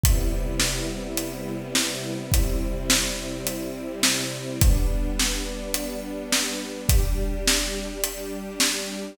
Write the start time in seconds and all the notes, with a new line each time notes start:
0.04 C3 G3 B3 E4, kick, closed hi-hat
0.60 snare
1.17 closed hi-hat
1.75 snare
2.32 C3 G3 C4 E4, kick, closed hi-hat
2.90 snare
3.47 closed hi-hat
4.03 snare
4.61 G3 B3 D4, kick, closed hi-hat
5.19 snare
5.74 closed hi-hat
6.33 snare
6.89 G3 D4 G4, kick, closed hi-hat
7.48 snare
8.04 closed hi-hat
8.60 snare